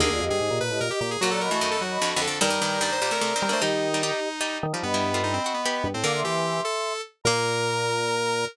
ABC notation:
X:1
M:3/4
L:1/16
Q:1/4=149
K:Bblyd
V:1 name="Flute"
[DB] [Fd] [G_e]5 [Ge]2 [Ge] z2 | [B_g] [db] [_e_c']5 [ec']2 [ec'] z2 | [db]12 | [G_e]8 z4 |
[^d=b]12 | [fd'] [ec'] [ec']8 z2 | b12 |]
V:2 name="Lead 1 (square)"
_A3 A3 _c2 B G G A | _G A B G2 A G4 A2 | B4 d c c B4 c | _E10 z2 |
=B,4 ^D C C B,4 C | B2 G4 A4 z2 | B12 |]
V:3 name="Harpsichord"
[D,B,]12 | [B,,_G,]3 _F, [_G,,_E,]4 (3[=F,,D,]2 [F,,D,]2 [F,,D,]2 | [G,,_E,] [G,,E,] [G,,E,]2 [G,,E,]2 [B,,G,] [C,A,] (3[C,A,]2 [E,C]2 [D,B,]2 | [G,_E]3 [G,E] [G,E]2 z2 [G,E]3 [G,E] |
z [G,E]2 [A,F]3 ^F2 [=B,G]3 z | [D,B,]6 z6 | B,12 |]
V:4 name="Drawbar Organ"
_E,, E,, F,, G,, _A,, B,, B,, =A,, B,, z B,,2 | _G,3 A,3 G,2 z4 | G,6 z4 G, A, | _E,6 z4 E, F, |
G,,6 z4 G,, A,, | D,2 E,4 z6 | B,,12 |]